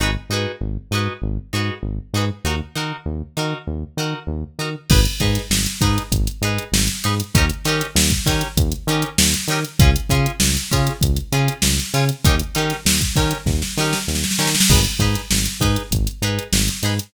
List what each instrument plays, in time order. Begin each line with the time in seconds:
0.00 synth bass 1 G#1, acoustic guitar (steel) D#4 F#4 G#4 B4
0.29 synth bass 1 G#2, acoustic guitar (steel) D#4 F#4 G#4
0.34 acoustic guitar (steel) B4
0.61 synth bass 1 G#1
0.91 synth bass 1 G#2, acoustic guitar (steel) D#4 F#4 G#4 B4
1.22 synth bass 1 G#1
1.53 synth bass 1 G#2, acoustic guitar (steel) D#4 F#4 G#4 B4
1.83 synth bass 1 G#1
2.14 synth bass 1 G#2, acoustic guitar (steel) D#4 F#4 G#4 B4
2.44 synth bass 1 D#2, acoustic guitar (steel) D#4 F#4 A#4
2.76 synth bass 1 D#3, acoustic guitar (steel) D#4 F#4 A#4
3.06 synth bass 1 D#2
3.37 synth bass 1 D#3, acoustic guitar (steel) D#4 F#4 A#4
3.67 synth bass 1 D#2
3.97 synth bass 1 D#3, acoustic guitar (steel) D#4 F#4 A#4
4.27 synth bass 1 D#2
4.59 synth bass 1 D#3, acoustic guitar (steel) D#4 F#4 A#4
4.90 synth bass 1 G#1, acoustic guitar (steel) D#4 G#4 B4, kick, crash
5.05 closed hi-hat
5.20 synth bass 1 G#2, acoustic guitar (steel) D#4 G#4 B4, kick, closed hi-hat
5.35 snare, closed hi-hat
5.50 synth bass 1 G#1, snare
5.66 closed hi-hat
5.81 synth bass 1 G#2, acoustic guitar (steel) D#4 G#4 B4, kick, closed hi-hat
5.98 closed hi-hat
6.12 synth bass 1 G#1, kick, closed hi-hat
6.27 closed hi-hat
6.41 synth bass 1 G#2, acoustic guitar (steel) D#4 G#4 B4, closed hi-hat
6.58 closed hi-hat
6.72 synth bass 1 G#1, snare
6.88 closed hi-hat
7.04 synth bass 1 G#2, acoustic guitar (steel) D#4 G#4 B4, closed hi-hat
7.20 closed hi-hat
7.34 synth bass 1 D#2, acoustic guitar (steel) C#4 D#4 G4 A#4, kick, closed hi-hat
7.49 closed hi-hat
7.65 synth bass 1 D#3, acoustic guitar (steel) C#4 D#4 G4 A#4, snare, closed hi-hat
7.81 closed hi-hat
7.95 synth bass 1 D#2, snare
8.10 kick, closed hi-hat
8.26 synth bass 1 D#3, acoustic guitar (steel) C#4 D#4 G4 A#4, kick, snare, closed hi-hat
8.41 closed hi-hat
8.57 synth bass 1 D#2, kick, closed hi-hat
8.72 closed hi-hat
8.87 synth bass 1 D#3, acoustic guitar (steel) C#4 D#4 G4 A#4, closed hi-hat
9.02 closed hi-hat
9.18 synth bass 1 D#2, snare
9.34 closed hi-hat
9.48 synth bass 1 D#3, acoustic guitar (steel) C#4 D#4 G4, closed hi-hat
9.52 acoustic guitar (steel) A#4
9.65 closed hi-hat
9.79 synth bass 1 C#2, acoustic guitar (steel) C#4 F4 G#4, kick, closed hi-hat
9.96 closed hi-hat
10.09 synth bass 1 C#3, acoustic guitar (steel) C#4 F4 G#4, kick, closed hi-hat
10.26 closed hi-hat
10.40 synth bass 1 C#2, snare
10.57 snare, closed hi-hat
10.71 synth bass 1 C#3, acoustic guitar (steel) C#4 F4 G#4, kick, closed hi-hat
10.87 closed hi-hat
11.01 synth bass 1 C#2, kick, closed hi-hat
11.16 closed hi-hat
11.32 synth bass 1 C#3, acoustic guitar (steel) C#4 F4 G#4, closed hi-hat
11.48 closed hi-hat
11.62 synth bass 1 C#2, snare
11.78 snare, closed hi-hat
11.94 synth bass 1 C#3, acoustic guitar (steel) C#4 F4 G#4, closed hi-hat
12.09 closed hi-hat
12.24 synth bass 1 D#2, acoustic guitar (steel) C#4 D#4 G4 A#4, kick, closed hi-hat
12.39 closed hi-hat
12.55 synth bass 1 D#3, acoustic guitar (steel) C#4 D#4 G4 A#4, closed hi-hat
12.70 snare, closed hi-hat
12.85 synth bass 1 D#2, snare
13.01 kick, closed hi-hat
13.16 synth bass 1 D#3, acoustic guitar (steel) C#4 D#4 G4 A#4, kick, snare, closed hi-hat
13.31 closed hi-hat
13.46 synth bass 1 D#2, kick, snare
13.62 snare
13.77 synth bass 1 D#3, acoustic guitar (steel) C#4 D#4 G4 A#4, snare
13.93 snare
14.08 synth bass 1 D#2, snare
14.15 snare
14.24 snare
14.31 snare
14.39 synth bass 1 D#3, acoustic guitar (steel) C#4 D#4 G4 A#4, snare
14.47 snare
14.55 snare
14.60 snare
14.70 synth bass 1 G#1, acoustic guitar (steel) D#4 G#4 B4, kick, crash
14.85 closed hi-hat
14.99 synth bass 1 G#2, acoustic guitar (steel) D#4 G#4 B4, kick, closed hi-hat
15.14 snare, closed hi-hat
15.31 synth bass 1 G#1, snare
15.46 closed hi-hat
15.60 synth bass 1 G#2, acoustic guitar (steel) D#4 G#4 B4, kick, closed hi-hat
15.76 closed hi-hat
15.91 synth bass 1 G#1, kick, closed hi-hat
16.07 closed hi-hat
16.22 synth bass 1 G#2, acoustic guitar (steel) D#4 G#4 B4, closed hi-hat
16.39 closed hi-hat
16.52 synth bass 1 G#1, snare
16.68 closed hi-hat
16.83 synth bass 1 G#2, acoustic guitar (steel) D#4 G#4 B4, closed hi-hat
16.99 closed hi-hat